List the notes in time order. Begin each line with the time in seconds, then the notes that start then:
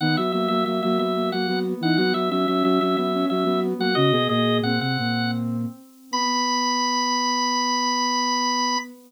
0.00 D#3 B3 D#4 F#5
0.17 F#3 F#4 E5
0.32 F#3 A#3 F#4 E5
0.48 F#3 A#3 F#4 E5
0.65 F#3 A#3 F#4 E5
0.81 F#3 A#3 F#4 E5
0.97 F#3 B3 F#4 E5
1.15 A#3
1.31 F#3 A#3 F#4 F#5
1.47 F#3 B3 F#4
1.65 B3
1.81 E3 D#4 E4 F#5
1.97 F#3 B3 F#4 F#5
2.14 F#3 F#4 E5
2.30 F#3 C#4 F#4 E5
2.47 F#3 C#4 F#4 E5
2.63 F#3 C#4 F#4 E5
2.80 F#3 C#4 F#4 E5
2.96 F#3 B3 F#4 E5
3.14 C#4
3.28 F#3 C#4 F#4 E5
3.45 F#3 B3 F#4
3.63 B3
3.79 F#3 A#3 F#4 F#5
3.94 C#3 C#4 F#4 D#5
4.12 B2 B3 G#4
4.29 A#2 A#3 G#4 D#5
4.62 A#2 A#3 C4 F#5
4.80 C3 C4 F#5
4.99 A#2 A#3
6.11 B3 B5